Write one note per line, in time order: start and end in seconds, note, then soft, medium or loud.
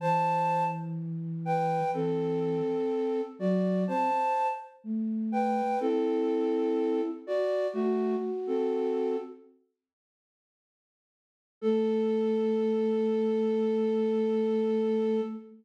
0.00 1.80 E3 medium
0.00 0.64 C5 medium
0.00 0.64 A5 medium
1.45 1.91 B4 medium
1.45 1.91 G5 medium
1.93 2.59 E3 medium
1.93 3.21 C4 medium
1.93 3.21 A4 medium
3.39 3.85 F#3 medium
3.39 3.84 F#4 medium
3.39 3.84 D5 medium
3.87 4.10 C4 medium
3.87 4.47 C5 medium
3.87 4.47 A5 medium
4.84 5.62 A3 medium
5.32 5.79 B4 medium
5.32 5.79 G5 medium
5.80 7.01 C4 medium
5.80 7.10 E4 medium
5.80 7.01 A4 medium
7.27 7.67 F#4 medium
7.27 7.67 D5 medium
7.73 8.16 A3 medium
7.73 8.16 F#4 medium
7.73 9.16 F#4 loud
8.47 9.17 C4 medium
8.47 9.17 A4 medium
11.61 15.21 A3 loud
11.61 15.21 A4 loud